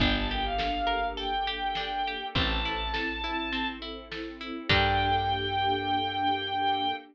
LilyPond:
<<
  \new Staff \with { instrumentName = "Violin" } { \time 4/4 \key g \minor \tempo 4 = 102 g''16 a''16 g''16 f''4~ f''16 g''2 | a''2~ a''8 r4. | g''1 | }
  \new Staff \with { instrumentName = "Pizzicato Strings" } { \time 4/4 \key g \minor d'8 g'8 a'8 bes'8 a'8 g'8 d'8 g'8 | c'8 e'8 a'8 e'8 c'8 e'8 a'8 e'8 | <d' g' a' bes'>1 | }
  \new Staff \with { instrumentName = "Electric Bass (finger)" } { \clef bass \time 4/4 \key g \minor g,,1 | a,,1 | g,1 | }
  \new Staff \with { instrumentName = "String Ensemble 1" } { \time 4/4 \key g \minor <bes d' g' a'>1 | <c' e' a'>1 | <bes d' g' a'>1 | }
  \new DrumStaff \with { instrumentName = "Drums" } \drummode { \time 4/4 <hh bd>4 sn4 hh4 sn4 | <hh bd>4 sn4 hh4 sn4 | <cymc bd>4 r4 r4 r4 | }
>>